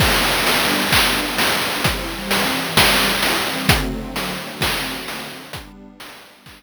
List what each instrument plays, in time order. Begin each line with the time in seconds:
0.00 pad 5 (bowed) G3 B3 D4, kick, crash
0.47 open hi-hat
0.92 kick, clap
1.38 open hi-hat
1.84 pad 5 (bowed) E3 G3 C4, kick, closed hi-hat
2.31 snare, open hi-hat
2.77 kick, snare
3.23 open hi-hat
3.69 pad 5 (bowed) D3 F#3 A3 C4, kick, closed hi-hat
4.16 open hi-hat
4.61 kick, snare
5.08 open hi-hat
5.53 pad 5 (bowed) G3 B3 D4, kick, closed hi-hat
6.00 snare, open hi-hat
6.46 kick, clap